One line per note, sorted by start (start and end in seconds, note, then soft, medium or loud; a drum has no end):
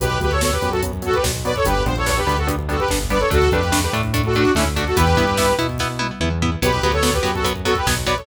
0.00 0.18 B1 loud
0.00 0.09 F#3 loud
0.00 0.09 B3 medium
0.00 0.18 G4 medium
0.00 0.18 B4 medium
0.00 kick medium
0.00 closed hi-hat medium
0.10 kick medium
0.20 0.56 D2 medium
0.20 0.29 F#3 medium
0.20 0.29 B3 medium
0.20 0.31 G4 medium
0.20 0.31 B4 medium
0.20 kick medium
0.20 closed hi-hat medium
0.31 0.41 A4 medium
0.31 0.41 C#5 medium
0.31 kick medium
0.41 0.51 F#3 medium
0.41 0.51 B3 loud
0.41 0.52 A4 medium
0.41 0.52 C#5 medium
0.41 kick medium
0.41 snare medium
0.52 0.69 G4 medium
0.52 0.69 B4 medium
0.52 kick medium
0.62 1.15 F#2 medium
0.62 0.70 F#3 medium
0.62 0.70 B3 medium
0.62 kick medium
0.62 closed hi-hat medium
0.71 0.81 F#4 medium
0.71 0.81 A4 medium
0.71 kick medium
0.82 0.92 F#3 medium
0.82 0.92 B3 medium
0.82 kick medium
0.82 closed hi-hat medium
0.93 kick medium
1.02 1.11 F#3 loud
1.02 1.11 B3 medium
1.02 1.15 F#4 medium
1.02 1.15 A4 medium
1.02 kick medium
1.02 closed hi-hat medium
1.14 1.24 G4 medium
1.14 1.24 B4 medium
1.14 kick medium
1.23 1.59 B1 medium
1.23 1.32 F#3 medium
1.23 1.32 B3 medium
1.23 kick medium
1.23 snare medium
1.35 kick medium
1.45 1.53 F#3 medium
1.45 1.53 B3 loud
1.45 1.54 B4 medium
1.45 1.54 D5 medium
1.45 kick medium
1.45 closed hi-hat medium
1.56 1.65 A4 medium
1.56 1.65 C#5 medium
1.56 kick medium
1.65 1.84 G1 loud
1.65 1.74 G3 loud
1.65 1.74 B3 loud
1.65 1.74 D4 loud
1.65 1.83 G4 medium
1.65 1.83 B4 medium
1.65 kick medium
1.65 closed hi-hat medium
1.75 kick medium
1.86 2.21 A#1 loud
1.86 1.94 G3 medium
1.86 1.94 B3 medium
1.86 1.94 D4 medium
1.86 1.96 C5 medium
1.86 kick medium
1.86 closed hi-hat medium
1.96 2.07 A4 medium
1.96 2.07 C#5 medium
1.96 kick medium
2.06 2.14 G3 medium
2.06 2.14 B3 medium
2.06 2.14 D4 medium
2.06 2.17 A4 medium
2.06 2.17 C#5 medium
2.06 kick medium
2.06 snare medium
2.17 2.37 G4 medium
2.17 2.37 B4 medium
2.17 kick medium
2.27 2.80 D2 medium
2.27 2.35 G3 medium
2.27 2.35 B3 medium
2.27 2.35 D4 medium
2.27 kick medium
2.27 closed hi-hat medium
2.37 2.48 F#4 medium
2.37 2.48 A4 medium
2.37 kick medium
2.47 2.56 G3 medium
2.47 2.56 B3 medium
2.47 2.56 D4 medium
2.47 kick medium
2.47 closed hi-hat medium
2.59 kick medium
2.69 2.77 G3 medium
2.69 2.77 B3 medium
2.69 2.77 D4 medium
2.69 2.80 F#4 medium
2.69 2.80 A4 medium
2.69 kick medium
2.69 closed hi-hat medium
2.79 2.89 G4 medium
2.79 2.89 B4 medium
2.79 kick medium
2.88 3.25 G1 medium
2.88 2.99 G3 medium
2.88 2.99 B3 medium
2.88 2.99 D4 medium
2.88 kick medium
2.88 snare medium
3.00 kick medium
3.10 3.19 G3 medium
3.10 3.19 B3 loud
3.10 3.19 D4 medium
3.10 3.20 B4 medium
3.10 3.20 D5 medium
3.10 kick medium
3.10 closed hi-hat medium
3.19 3.29 A4 medium
3.19 3.29 C#5 medium
3.19 kick medium
3.30 3.49 D2 loud
3.30 3.39 A3 loud
3.30 3.39 D4 loud
3.30 3.50 F#4 medium
3.30 3.50 A4 medium
3.30 kick medium
3.30 closed hi-hat medium
3.42 kick medium
3.51 3.87 F2 loud
3.51 3.61 A3 medium
3.51 3.61 D4 medium
3.51 3.77 G4 medium
3.51 3.77 B4 medium
3.51 kick medium
3.51 closed hi-hat medium
3.63 kick medium
3.72 3.80 A3 medium
3.72 3.80 D4 medium
3.72 kick medium
3.72 snare loud
3.82 3.92 G4 medium
3.82 3.92 B4 medium
3.82 kick medium
3.93 4.46 A2 loud
3.93 4.02 A3 medium
3.93 4.02 D4 medium
3.93 kick medium
3.93 closed hi-hat medium
4.03 kick medium
4.14 4.22 A3 loud
4.14 4.22 D4 medium
4.14 kick medium
4.14 closed hi-hat medium
4.24 4.35 F#4 medium
4.24 4.36 A4 medium
4.24 kick medium
4.34 4.44 A3 medium
4.34 4.52 D4 medium
4.34 4.44 D4 medium
4.34 4.52 F#4 medium
4.34 kick medium
4.34 closed hi-hat medium
4.45 kick medium
4.55 4.90 D2 medium
4.55 4.64 A3 loud
4.55 4.65 C#4 medium
4.55 4.64 D4 medium
4.55 4.65 E4 medium
4.55 kick medium
4.55 snare medium
4.65 kick medium
4.75 4.85 A3 medium
4.75 4.85 D4 medium
4.75 4.85 F#4 medium
4.75 kick medium
4.75 closed hi-hat medium
4.86 4.96 F#4 medium
4.86 4.96 A4 medium
4.86 kick medium
4.95 5.15 E2 loud
4.95 5.05 B3 loud
4.95 5.05 E4 loud
4.95 5.54 G4 medium
4.95 5.54 B4 medium
4.95 kick medium
4.95 closed hi-hat medium
5.07 kick medium
5.16 5.52 G2 medium
5.16 5.25 B3 medium
5.16 5.25 E4 medium
5.16 kick medium
5.16 closed hi-hat medium
5.27 kick medium
5.37 5.46 B3 medium
5.37 5.46 E4 medium
5.37 kick medium
5.37 snare medium
5.47 kick medium
5.58 6.11 B2 medium
5.58 5.67 B3 medium
5.58 5.67 E4 medium
5.58 kick medium
5.58 closed hi-hat medium
5.69 kick medium
5.78 5.88 B3 loud
5.78 5.88 E4 medium
5.78 kick medium
5.78 snare medium
5.99 6.07 B3 medium
5.99 6.07 E4 medium
5.99 high tom medium
6.20 6.56 E2 medium
6.20 6.29 B3 medium
6.20 6.29 E4 medium
6.20 mid tom medium
6.42 6.50 B3 medium
6.42 6.50 E4 medium
6.42 floor tom medium
6.62 6.79 B1 loud
6.62 6.71 F#3 loud
6.62 6.71 B3 medium
6.62 6.82 G4 medium
6.62 6.82 B4 medium
6.62 kick medium
6.62 closed hi-hat medium
6.73 kick medium
6.82 7.18 D2 medium
6.82 6.92 F#3 medium
6.82 6.92 B3 medium
6.82 6.92 G4 medium
6.82 6.92 B4 medium
6.82 kick medium
6.82 closed hi-hat medium
6.92 7.02 A4 medium
6.92 7.02 C#5 medium
6.92 kick medium
7.03 7.11 F#3 medium
7.03 7.11 B3 loud
7.03 7.13 A4 medium
7.03 7.13 C#5 medium
7.03 kick medium
7.03 snare medium
7.13 7.31 G4 medium
7.13 7.31 B4 medium
7.13 kick medium
7.23 7.76 F#2 medium
7.23 7.31 F#3 medium
7.23 7.31 B3 medium
7.23 kick medium
7.23 closed hi-hat medium
7.34 7.44 F#4 medium
7.34 7.44 A4 medium
7.34 kick medium
7.44 7.53 F#3 medium
7.44 7.53 B3 medium
7.44 kick medium
7.44 closed hi-hat medium
7.56 kick medium
7.65 7.74 F#3 loud
7.65 7.74 B3 medium
7.65 7.75 F#4 medium
7.65 7.75 A4 medium
7.65 kick medium
7.65 closed hi-hat medium
7.75 7.86 G4 medium
7.75 7.86 B4 medium
7.75 kick medium
7.86 8.21 B1 medium
7.86 7.95 F#3 medium
7.86 7.95 B3 medium
7.86 kick medium
7.86 snare medium
7.97 kick medium
8.06 8.15 F#3 medium
8.06 8.15 B3 loud
8.06 8.16 B4 medium
8.06 8.16 D5 medium
8.06 kick medium
8.06 closed hi-hat medium
8.17 8.26 A4 medium
8.17 8.26 C#5 medium
8.17 kick medium